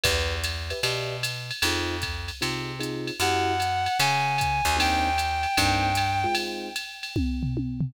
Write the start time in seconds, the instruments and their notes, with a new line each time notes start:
0.04 electric bass (finger) E2, acoustic grand piano G4 B4 D5 E5, kick, ride
0.44 hi-hat pedal, ride
0.70 acoustic grand piano G4 B4 D5 E5, ride
0.83 electric bass (finger) B2, acoustic grand piano G4 B4 D5 E5, ride
1.23 hi-hat pedal, ride
1.51 ride
1.62 electric bass (finger) F2, acoustic grand piano C4 D#4 F4 G#4, ride
2.02 kick, hi-hat pedal, ride
2.28 ride
2.41 electric bass (finger) C3, acoustic grand piano C4 D#4 F4 G#4, ride
2.79 acoustic grand piano C4 D#4 F4 G#4, hi-hat pedal, ride
3.07 ride
3.20 electric bass (finger) F#2, acoustic grand piano A#3 E4 F#4 G4, clarinet F#5, ride
3.60 hi-hat pedal, ride
3.86 ride
4.00 electric bass (finger) C#3, clarinet G#5, ride
4.38 kick, hi-hat pedal, ride
4.65 electric bass (finger) D#2, ride
4.77 acoustic grand piano A#3 C4 D4 D#4, clarinet G5, ride
5.18 hi-hat pedal, ride
5.43 ride
5.57 electric bass (finger) G2, acoustic grand piano A#3 C4 D4 D#4, kick, ride
5.95 hi-hat pedal, ride
6.24 acoustic grand piano G#3 C4 D#4 F4
6.35 ride
6.76 hi-hat pedal, ride
7.03 ride
7.16 kick, high tom
7.43 floor tom
7.57 high tom
7.81 floor tom